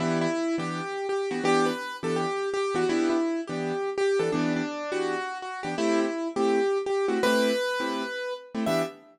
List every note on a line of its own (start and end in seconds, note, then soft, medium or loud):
0.00 0.27 E3 loud
0.00 0.27 B3 medium
0.00 0.27 D4 medium
0.00 0.18 E4 loud
0.00 0.27 G4 medium
0.21 0.56 E4 loud
0.58 0.81 E3 medium
0.58 0.81 B3 medium
0.58 0.81 D4 medium
0.58 1.07 G4 medium
1.09 1.30 G4 medium
1.31 1.41 E3 medium
1.31 1.41 B3 medium
1.31 1.41 D4 medium
1.31 1.44 F#4 medium
1.31 1.41 G4 medium
1.44 1.71 E3 loud
1.44 1.71 B3 loud
1.44 1.71 D4 loud
1.44 1.66 G4 loud
1.66 1.96 B4 medium
2.03 2.26 E3 medium
2.03 2.26 B3 medium
2.03 2.26 D4 medium
2.03 2.26 G4 medium
2.03 2.16 A4 medium
2.16 2.49 G4 loud
2.54 2.75 G4 loud
2.75 2.84 E3 medium
2.75 2.84 B3 medium
2.75 2.84 D4 medium
2.75 2.88 F#4 loud
2.75 2.84 G4 medium
2.89 3.17 E3 loud
2.89 3.17 B3 loud
2.89 3.17 D4 medium
2.89 3.09 E4 loud
2.89 3.17 G4 loud
3.10 3.41 E4 medium
3.47 3.72 E3 medium
3.47 3.72 B3 medium
3.47 3.72 D4 medium
3.47 3.90 G4 medium
3.98 4.19 G4 loud
4.19 4.29 E3 medium
4.19 4.29 B3 medium
4.19 4.29 D4 medium
4.19 4.29 G4 medium
4.19 4.31 A4 medium
4.32 4.62 E3 loud
4.32 4.62 B3 loud
4.32 4.53 D4 loud
4.32 4.62 G4 medium
4.56 4.91 D4 loud
4.92 5.15 E3 medium
4.92 5.15 B3 medium
4.92 5.15 D4 medium
4.92 5.38 F#4 loud
4.92 5.15 G4 medium
5.42 5.60 F#4 medium
5.63 5.74 E3 medium
5.63 5.74 B3 medium
5.63 5.74 D4 medium
5.63 5.75 G4 medium
5.78 6.06 A3 loud
5.78 6.06 C4 loud
5.78 6.00 E4 loud
5.78 6.06 G4 loud
6.00 6.28 E4 medium
6.36 6.59 A3 medium
6.36 6.59 C4 medium
6.36 6.59 E4 medium
6.36 6.78 G4 loud
6.86 7.06 G4 medium
7.08 7.18 A3 medium
7.08 7.18 C4 medium
7.08 7.18 E4 medium
7.08 7.21 F#4 medium
7.08 7.18 G4 medium
7.23 7.51 A3 loud
7.23 7.51 C4 loud
7.23 7.51 E4 medium
7.23 7.51 G4 loud
7.23 8.34 B4 loud
7.80 8.03 A3 medium
7.80 8.03 C4 medium
7.80 8.03 E4 medium
7.80 8.03 G4 medium
8.55 8.64 A3 loud
8.55 8.64 C4 medium
8.55 8.64 E4 medium
8.55 8.64 G4 medium
8.66 8.83 E3 loud
8.66 8.83 B3 loud
8.66 8.83 D4 loud
8.66 8.83 G4 medium
8.66 8.82 E5 loud